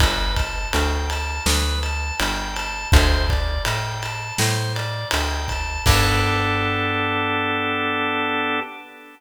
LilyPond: <<
  \new Staff \with { instrumentName = "Drawbar Organ" } { \time 4/4 \key g \major \tempo 4 = 82 b'8 a''8 g''8 a''8 b'8 a''8 g''8 a''8 | c''8 d''8 g''8 a''8 c''8 d''8 g''8 a''8 | <b d' g' a'>1 | }
  \new Staff \with { instrumentName = "Electric Bass (finger)" } { \clef bass \time 4/4 \key g \major g,,4 d,4 d,4 g,,4 | d,4 a,4 a,4 d,4 | g,1 | }
  \new DrumStaff \with { instrumentName = "Drums" } \drummode { \time 4/4 <bd cymr>8 <bd cymr>8 cymr8 cymr8 sn8 cymr8 cymr8 cymr8 | <bd cymr>8 <bd cymr>8 cymr8 cymr8 sn8 cymr8 cymr8 <bd cymr>8 | <cymc bd>4 r4 r4 r4 | }
>>